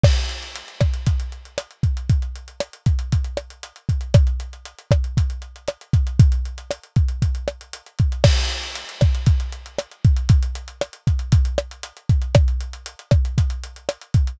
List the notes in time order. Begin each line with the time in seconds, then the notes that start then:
0.04 kick, cross-stick, crash
0.16 closed hi-hat
0.29 closed hi-hat
0.43 closed hi-hat
0.56 closed hi-hat
0.68 closed hi-hat
0.81 kick, cross-stick, closed hi-hat
0.94 closed hi-hat
1.07 kick, closed hi-hat
1.20 closed hi-hat
1.32 closed hi-hat
1.45 closed hi-hat
1.58 cross-stick, closed hi-hat
1.71 closed hi-hat
1.83 kick, closed hi-hat
1.97 closed hi-hat
2.10 kick, closed hi-hat
2.22 closed hi-hat
2.36 closed hi-hat
2.48 closed hi-hat
2.60 cross-stick, closed hi-hat
2.73 closed hi-hat
2.86 kick, closed hi-hat
2.99 closed hi-hat
3.12 kick, closed hi-hat
3.24 closed hi-hat
3.37 cross-stick, closed hi-hat
3.50 closed hi-hat
3.63 closed hi-hat
3.76 closed hi-hat
3.89 kick, closed hi-hat
4.01 closed hi-hat
4.14 kick, cross-stick, closed hi-hat
4.27 closed hi-hat
4.40 closed hi-hat
4.53 closed hi-hat
4.65 closed hi-hat
4.79 closed hi-hat
4.91 kick, cross-stick, closed hi-hat
5.04 closed hi-hat
5.17 kick, closed hi-hat
5.30 closed hi-hat
5.42 closed hi-hat
5.56 closed hi-hat
5.68 cross-stick, closed hi-hat
5.81 closed hi-hat
5.93 kick, closed hi-hat
6.07 closed hi-hat
6.20 kick, closed hi-hat
6.32 closed hi-hat
6.45 closed hi-hat
6.58 closed hi-hat
6.71 cross-stick, closed hi-hat
6.83 closed hi-hat
6.96 kick, closed hi-hat
7.08 closed hi-hat
7.22 kick, closed hi-hat
7.35 closed hi-hat
7.48 cross-stick, closed hi-hat
7.61 closed hi-hat
7.73 closed hi-hat
7.86 closed hi-hat
7.99 kick, closed hi-hat
8.12 closed hi-hat
8.24 kick, cross-stick, crash
8.37 closed hi-hat
8.50 closed hi-hat
8.63 closed hi-hat
8.75 closed hi-hat
8.89 closed hi-hat
9.01 kick, cross-stick, closed hi-hat
9.15 closed hi-hat
9.26 kick, closed hi-hat
9.40 closed hi-hat
9.52 closed hi-hat
9.66 closed hi-hat
9.79 cross-stick, closed hi-hat
9.91 closed hi-hat
10.04 kick, closed hi-hat
10.16 closed hi-hat
10.29 kick, closed hi-hat
10.43 closed hi-hat
10.55 closed hi-hat
10.68 closed hi-hat
10.81 cross-stick, closed hi-hat
10.93 closed hi-hat
11.07 kick, closed hi-hat
11.19 closed hi-hat
11.32 kick, closed hi-hat
11.45 closed hi-hat
11.58 cross-stick, closed hi-hat
11.71 closed hi-hat
11.83 closed hi-hat
11.97 closed hi-hat
12.09 kick, closed hi-hat
12.22 closed hi-hat
12.35 kick, cross-stick, closed hi-hat
12.48 closed hi-hat
12.61 closed hi-hat
12.73 closed hi-hat
12.86 closed hi-hat
12.99 closed hi-hat
13.11 kick, cross-stick, closed hi-hat
13.25 closed hi-hat
13.38 kick, closed hi-hat
13.50 closed hi-hat
13.64 closed hi-hat
13.76 closed hi-hat
13.89 cross-stick, closed hi-hat
14.01 closed hi-hat
14.14 kick, closed hi-hat
14.27 closed hi-hat